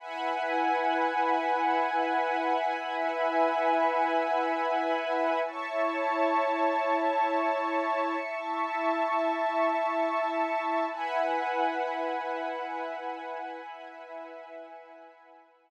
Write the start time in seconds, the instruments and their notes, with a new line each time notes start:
0.00 pad 2 (warm) E4 B4 F#5 G#5, string ensemble 1 E5 F#5 G#5 B5
2.72 pad 2 (warm) E4 B4 E5 G#5
5.45 pad 2 (warm) E4 C#5 A5, string ensemble 1 E5 A5 C#6
8.20 pad 2 (warm) E4 E5 A5
10.91 pad 2 (warm) E4 B4 F#5 G#5, string ensemble 1 E5 F#5 G#5 B5
13.63 pad 2 (warm) E4 B4 E5 G#5